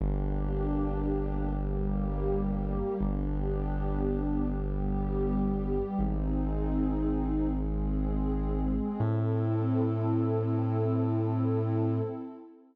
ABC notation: X:1
M:3/4
L:1/8
Q:1/4=60
K:Am
V:1 name="Pad 2 (warm)"
[_B,DG]3 [G,B,G]3 | [B,DG]3 [G,B,G]3 | [^B,^D^G]3 [^G,B,G]3 | [CEA]6 |]
V:2 name="Synth Bass 2" clef=bass
G,,,6 | G,,,6 | ^G,,,6 | A,,6 |]